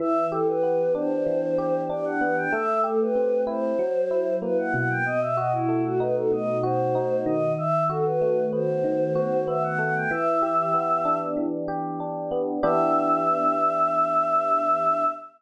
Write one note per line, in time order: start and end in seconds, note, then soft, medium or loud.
0.00 1.26 E3 medium
0.00 0.26 E5 medium
0.32 1.58 G4 medium
0.32 0.47 A4 medium
0.47 0.93 B4 medium
0.63 2.21 B3 medium
0.95 1.89 D4 medium
0.95 1.81 C5 medium
1.26 2.46 E3 medium
1.58 2.48 G4 medium
1.89 2.49 D4 medium
1.89 2.05 D5 medium
2.05 2.20 F#5 medium
2.21 2.51 B3 medium
2.21 2.36 F#5 medium
2.37 2.52 G5 medium
2.52 3.72 A3 medium
2.52 2.81 E5 medium
2.84 3.74 G4 medium
2.84 2.99 A4 medium
3.00 3.43 B4 medium
3.15 3.75 C4 medium
3.47 3.77 E4 medium
3.47 4.34 C5 medium
3.79 4.99 F#3 medium
4.11 5.01 E4 medium
4.42 5.02 A#3 medium
4.42 4.57 B4 medium
4.58 4.73 F#5 medium
4.74 6.31 B2 medium
4.74 4.89 F#5 medium
4.89 5.04 G5 medium
5.05 5.20 D#5 medium
5.21 5.36 E5 medium
5.37 6.63 F#4 medium
5.37 5.52 D#5 medium
5.52 5.83 E4 medium
5.69 7.49 A3 medium
5.84 5.99 F#4 medium
6.00 6.94 D#4 medium
6.00 6.15 B4 medium
6.16 6.31 A4 medium
6.32 7.52 B2 medium
6.32 6.58 D#5 medium
6.63 7.53 F#4 medium
6.63 7.21 C5 medium
6.95 7.55 D#4 medium
7.26 8.83 D#3 medium
7.26 7.53 D#5 medium
7.58 7.84 E5 medium
7.89 9.15 F#4 medium
7.89 8.05 A4 medium
8.05 8.45 B4 medium
8.21 9.78 A3 medium
8.53 9.47 B3 medium
8.53 9.44 C5 medium
8.84 10.04 D#3 medium
9.15 10.05 F#4 medium
9.47 10.08 B3 medium
9.47 9.62 E5 medium
9.63 9.78 F#5 medium
9.79 10.09 A3 medium
9.79 9.94 F#5 medium
9.95 10.10 G5 medium
10.11 11.36 E3 medium
10.11 11.18 E5 medium
10.42 11.68 G4 medium
10.74 12.31 B3 medium
11.05 12.00 D4 medium
11.37 12.57 E3 medium
11.68 12.58 G4 medium
12.00 12.60 D4 medium
12.31 12.61 B3 medium
12.63 15.04 E3 loud
12.63 15.04 B3 loud
12.63 15.04 D4 loud
12.63 15.04 G4 loud
12.63 15.04 E5 loud